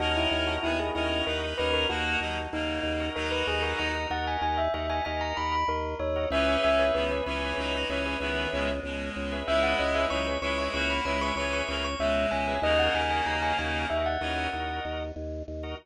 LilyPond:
<<
  \new Staff \with { instrumentName = "Tubular Bells" } { \time 5/4 \key dis \phrygian \tempo 4 = 95 fis'16 e'8 fis'16 e'16 gis'16 e'8 ais'8 b'16 ais'16 fis'4 dis'4 | ais'16 b'16 gis'16 ais'16 ais''8 fis''16 gis''16 gis''16 e''16 e''16 gis''16 gis''16 ais''16 b''16 b''16 ais'8 cis''8 | e''8 e''8 b'2. r4 | e''16 fis''16 dis''16 e''16 cis'''8 cis'''16 cis'''16 cis'''16 b''16 b''16 cis'''16 cis'''16 cis'''16 cis'''16 cis'''16 e''8 gis''8 |
dis''16 fis''16 gis''16 gis''16 ais''16 gis''16 gis''8 e''16 fis''4~ fis''16 r4. | }
  \new Staff \with { instrumentName = "Clarinet" } { \time 5/4 \key dis \phrygian <cis' ais'>4 <b gis'>16 r16 <cis' ais'>8 <dis' b'>16 <dis' b'>16 <cis' ais'>8 <ais fis'>8 <fis dis'>16 r16 <cis ais>4 | <fis dis'>4. r2. r8 | <e cis'>4 <dis b>16 r16 <e cis'>8 <fis dis'>16 <fis dis'>16 <e cis'>8 <dis b>8 <b, gis>16 r16 <b, gis>4 | <gis e'>4 <fis dis'>16 r16 <gis e'>8 <ais fis'>16 <ais fis'>16 <gis e'>8 <e cis'>8 <cis ais>16 r16 <b, gis>4 |
<cis ais>2 r8 <e cis'>8 r2 | }
  \new Staff \with { instrumentName = "Drawbar Organ" } { \time 5/4 \key dis \phrygian <fis' ais' dis''>8. <fis' ais' dis''>8 <fis' ais' dis''>16 <fis' ais' dis''>4 <fis' ais' dis''>16 <fis' ais' dis''>16 <fis' ais' dis''>4.~ <fis' ais' dis''>16 <fis' ais' dis''>16~ | <fis' ais' dis''>8. <fis' ais' dis''>8 <fis' ais' dis''>16 <fis' ais' dis''>4 <fis' ais' dis''>16 <fis' ais' dis''>16 <fis' ais' dis''>4.~ <fis' ais' dis''>16 <fis' ais' dis''>16 | <gis' b' cis'' e''>8. <gis' b' cis'' e''>8 <gis' b' cis'' e''>16 <gis' b' cis'' e''>4 <gis' b' cis'' e''>16 <gis' b' cis'' e''>16 <gis' b' cis'' e''>4.~ <gis' b' cis'' e''>16 <gis' b' cis'' e''>16~ | <gis' b' cis'' e''>8. <gis' b' cis'' e''>8 <gis' b' cis'' e''>16 <gis' b' cis'' e''>4 <gis' b' cis'' e''>16 <gis' b' cis'' e''>16 <gis' b' cis'' e''>4.~ <gis' b' cis'' e''>16 <gis' b' cis'' e''>16 |
<fis' ais' dis''>8. <fis' ais' dis''>8 <fis' ais' dis''>16 <fis' ais' dis''>4 <fis' ais' dis''>16 <fis' ais' dis''>16 <fis' ais' dis''>4.~ <fis' ais' dis''>16 <fis' ais' dis''>16 | }
  \new Staff \with { instrumentName = "Drawbar Organ" } { \clef bass \time 5/4 \key dis \phrygian dis,8 dis,8 dis,8 dis,8 dis,8 dis,8 dis,8 dis,8 dis,8 dis,8 | dis,8 dis,8 dis,8 dis,8 dis,8 dis,8 dis,8 dis,8 dis,8 dis,8 | cis,8 cis,8 cis,8 cis,8 cis,8 cis,8 cis,8 cis,8 cis,8 cis,8 | cis,8 cis,8 cis,8 cis,8 cis,8 cis,8 cis,8 cis,8 cis,8 cis,8 |
dis,8 dis,8 dis,8 dis,8 dis,8 dis,8 dis,8 dis,8 dis,8 dis,8 | }
>>